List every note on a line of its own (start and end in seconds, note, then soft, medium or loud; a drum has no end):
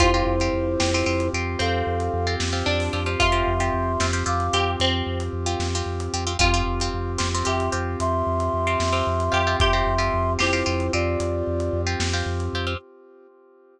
0.00 0.22 F2 medium
0.00 6.33 C4 medium
0.00 0.11 C4 medium
0.00 1.29 E4 medium
0.00 1.23 F4 loud
0.00 6.33 F4 medium
0.00 0.11 F4 loud
0.00 6.33 G4 medium
0.00 0.11 G4 loud
0.00 1.29 C5 loud
0.00 kick loud
0.00 closed hi-hat loud
0.14 0.35 C4 medium
0.14 0.35 F4 medium
0.14 0.35 G4 medium
0.26 0.49 F2 medium
0.40 0.73 C4 medium
0.40 0.73 F4 medium
0.40 0.73 G4 medium
0.40 closed hi-hat medium
0.53 0.76 F2 medium
0.80 1.03 F2 medium
0.80 0.90 C4 medium
0.80 0.90 F4 medium
0.80 0.90 G4 medium
0.80 snare loud
0.94 1.05 C4 medium
0.94 1.05 F4 medium
0.94 1.05 G4 medium
1.06 1.29 F2 medium
1.06 1.28 C4 medium
1.06 1.28 F4 medium
1.06 1.28 G4 medium
1.20 closed hi-hat medium
1.33 1.56 F2 medium
1.33 1.77 C4 medium
1.33 1.77 F4 medium
1.33 1.77 G4 medium
1.59 1.83 F2 medium
1.59 2.45 C4 medium
1.59 2.35 A4 medium
1.59 2.35 F5 medium
1.59 closed hi-hat medium
1.87 2.09 F2 medium
2.00 closed hi-hat medium
2.14 2.36 F2 medium
2.27 2.48 C4 medium
2.27 2.48 F4 medium
2.27 2.48 G4 medium
2.40 2.63 F2 medium
2.40 snare loud
2.53 2.85 C4 loud
2.53 2.85 F4 medium
2.53 2.85 G4 medium
2.66 2.89 F2 medium
2.66 3.10 D4 loud
2.80 open hi-hat medium
2.93 3.16 F2 medium
2.93 3.04 C4 medium
2.93 3.04 F4 medium
2.93 3.04 G4 medium
3.06 3.28 C4 medium
3.06 3.28 F4 medium
3.06 3.28 G4 medium
3.20 3.42 F2 medium
3.20 4.46 F4 loud
3.20 4.06 E5 medium
3.20 4.06 C6 medium
3.20 kick medium
3.20 closed hi-hat loud
3.32 3.53 C4 medium
3.32 3.53 F4 medium
3.32 3.53 G4 medium
3.47 3.70 F2 medium
3.60 3.92 C4 medium
3.60 3.92 F4 medium
3.60 3.92 G4 medium
3.60 closed hi-hat medium
3.74 3.96 F2 medium
4.00 4.23 F2 medium
4.00 4.11 C4 medium
4.00 4.11 F4 medium
4.00 4.11 G4 medium
4.00 snare loud
4.13 4.24 C4 medium
4.13 4.24 F4 medium
4.13 4.24 G4 medium
4.26 4.49 F2 medium
4.26 4.47 C4 medium
4.26 4.47 F4 medium
4.26 4.47 G4 medium
4.26 4.71 F5 medium
4.26 4.71 D6 medium
4.40 closed hi-hat medium
4.53 4.76 F2 medium
4.53 4.96 C4 medium
4.53 4.96 F4 medium
4.53 4.96 G4 medium
4.53 4.76 G4 medium
4.80 5.02 F2 medium
4.80 5.25 C4 medium
4.80 closed hi-hat medium
5.07 5.29 F2 medium
5.20 closed hi-hat medium
5.33 5.56 F2 medium
5.46 5.68 C4 medium
5.46 5.68 F4 medium
5.46 5.68 G4 medium
5.60 5.82 F2 medium
5.60 snare medium
5.75 6.07 C4 medium
5.75 6.07 F4 medium
5.75 6.07 G4 medium
5.86 6.09 F2 medium
6.00 closed hi-hat medium
6.13 6.36 F2 medium
6.13 6.24 C4 medium
6.13 6.24 F4 medium
6.13 6.24 G4 medium
6.27 6.37 C4 medium
6.27 6.37 F4 medium
6.27 6.37 G4 medium
6.39 6.62 F2 loud
6.39 6.50 C4 loud
6.39 12.74 C4 medium
6.39 6.50 F4 loud
6.39 12.74 F4 medium
6.39 7.11 F4 loud
6.39 6.50 G4 medium
6.39 12.74 G4 medium
6.39 kick loud
6.39 closed hi-hat loud
6.54 6.75 C4 medium
6.54 6.75 F4 medium
6.54 6.75 G4 medium
6.67 6.89 F2 medium
6.80 7.13 C4 medium
6.80 7.13 F4 medium
6.80 7.13 G4 medium
6.80 closed hi-hat medium
6.94 7.17 F2 medium
7.18 7.43 F2 medium
7.18 7.29 C4 medium
7.18 7.29 F4 medium
7.18 7.29 G4 medium
7.18 snare loud
7.35 7.45 C4 medium
7.35 7.45 F4 medium
7.35 7.45 G4 medium
7.45 7.69 F2 medium
7.45 7.66 C4 medium
7.45 7.66 F4 medium
7.45 7.66 G4 medium
7.45 7.98 G4 medium
7.45 7.70 E5 medium
7.45 7.70 C6 medium
7.60 closed hi-hat medium
7.72 7.96 F2 medium
7.72 8.15 C4 medium
7.72 8.15 F4 medium
7.72 8.15 G4 medium
8.00 8.22 F2 medium
8.00 9.56 E5 medium
8.00 9.56 C6 loud
8.00 closed hi-hat loud
8.27 8.49 F2 medium
8.40 closed hi-hat medium
8.54 8.76 F2 medium
8.67 8.88 C4 medium
8.67 8.88 F4 medium
8.67 8.88 G4 medium
8.80 9.02 F2 medium
8.80 snare loud
8.93 9.25 C4 medium
8.93 9.25 F4 medium
8.93 9.25 G4 medium
9.07 9.29 F2 medium
9.20 closed hi-hat medium
9.32 9.56 F2 medium
9.32 9.42 C4 medium
9.32 9.42 F4 medium
9.32 9.42 G4 medium
9.32 9.57 G4 loud
9.47 9.68 C4 medium
9.47 9.68 F4 medium
9.47 9.68 G4 medium
9.60 9.82 F2 medium
9.60 10.37 G4 loud
9.60 10.33 E5 medium
9.60 10.33 C6 loud
9.60 kick loud
9.60 closed hi-hat loud
9.73 9.94 C4 medium
9.73 9.94 F4 medium
9.73 9.94 G4 medium
9.87 10.10 F2 medium
9.98 10.30 C4 medium
9.98 10.30 F4 medium
9.98 10.30 G4 medium
9.98 closed hi-hat medium
10.14 10.37 F2 medium
10.39 10.63 F2 medium
10.39 10.49 C4 medium
10.39 10.92 E4 medium
10.39 10.49 F4 loud
10.39 10.49 G4 medium
10.39 11.92 G4 loud
10.39 10.92 C5 medium
10.39 snare medium
10.53 10.63 C4 medium
10.53 10.63 F4 medium
10.53 10.63 G4 medium
10.66 10.90 F2 medium
10.66 10.87 C4 medium
10.66 10.87 F4 medium
10.66 10.87 G4 medium
10.80 closed hi-hat medium
10.93 11.16 F2 medium
10.93 11.36 C4 medium
10.93 11.36 F4 medium
10.93 11.81 F4 medium
10.93 11.36 G4 medium
10.93 11.81 D5 medium
11.20 11.43 F2 medium
11.20 closed hi-hat medium
11.47 11.70 F2 medium
11.60 closed hi-hat medium
11.73 11.96 F2 medium
11.87 12.08 C4 medium
11.87 12.08 F4 medium
11.87 12.08 G4 medium
12.00 12.22 F2 medium
12.00 snare loud
12.13 12.45 C4 medium
12.13 12.45 F4 medium
12.13 12.45 G4 medium
12.26 12.49 F2 medium
12.40 closed hi-hat medium
12.53 12.76 F2 medium
12.53 12.66 C4 medium
12.53 12.66 F4 medium
12.53 12.66 G4 medium
12.67 12.77 C4 medium
12.67 12.77 F4 medium
12.67 12.77 G4 medium